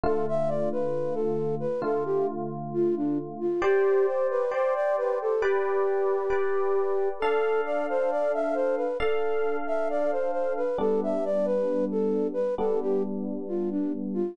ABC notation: X:1
M:4/4
L:1/16
Q:1/4=67
K:C
V:1 name="Flute"
A e d B2 A2 B A G z2 F D z F | G2 c B c d B A G8 | A2 d c d e c B A3 e d c c B | A e d B2 A2 B A G z2 F D z F |]
V:2 name="Electric Piano 1"
[D,A,F]8 [D,A,F]8 | [Gcd]4 [Gcd]4 [GBd]4 [GBd]4 | [DAf]8 [DAf]8 | [G,B,D]8 [G,B,D]8 |]